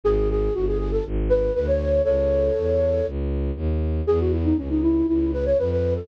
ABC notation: X:1
M:4/4
L:1/16
Q:1/4=119
K:C#m
V:1 name="Flute"
G2 G2 F G G A z2 B2 B c3 | [Ac]10 z6 | G F E D C D E2 E2 B c B B2 A |]
V:2 name="Violin" clef=bass
G,,,4 =G,,,4 ^G,,,4 =D,,4 | C,,4 E,,4 C,,4 D,,4 | E,,4 C,,4 C,,4 =F,,4 |]